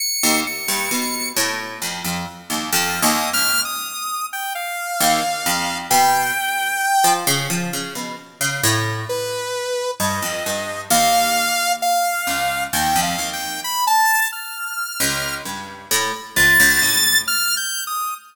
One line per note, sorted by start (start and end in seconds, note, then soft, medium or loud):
0.00 0.40 C#7 medium
0.23 0.44 D#2 loud
0.47 1.29 C#7 medium
0.68 0.89 G2 medium
0.91 1.32 B2 medium
1.37 1.77 A2 loud
1.82 2.02 F2 medium
2.05 2.25 F2 medium
2.50 2.70 D#2 medium
2.73 3.00 F2 loud
2.73 3.00 F6 medium
3.02 3.30 D#2 loud
3.02 3.30 D#6 medium
3.33 3.60 C#2 medium
3.33 3.61 F6 loud
3.65 4.26 D#6 medium
4.33 4.53 G5 medium
4.55 5.78 F5 medium
5.00 5.21 D#2 loud
5.46 5.87 F2 medium
5.90 6.32 B2 loud
5.90 7.13 G5 medium
7.04 7.25 F3 loud
7.27 7.48 C#3 loud
7.50 7.70 F3 medium
7.73 7.94 C#3 medium
7.95 8.16 B2 medium
8.41 8.61 C#3 medium
8.63 9.04 A2 loud
9.09 9.91 B4 medium
10.00 10.20 G2 medium
10.00 10.82 D#5 medium
10.22 10.43 F2 medium
10.46 10.87 G2 medium
10.90 12.13 D#2 loud
10.90 11.73 F5 loud
11.82 12.64 F5 medium
12.27 12.68 C#2 medium
12.73 12.94 D#2 medium
12.73 13.00 G5 medium
12.96 13.16 F2 medium
13.02 13.30 F5 medium
13.18 13.59 D#2 medium
13.33 13.60 G5 medium
13.64 13.85 B5 medium
13.87 14.28 A5 loud
14.32 15.35 F6 medium
15.00 15.41 C#2 medium
15.45 15.86 G2 soft
15.91 16.11 A2 loud
16.36 16.57 C#2 medium
16.36 17.18 A6 loud
16.60 16.80 C#2 loud
16.82 17.23 A2 medium
17.28 17.55 F6 loud
17.57 17.84 G6 medium
17.87 18.14 D#6 medium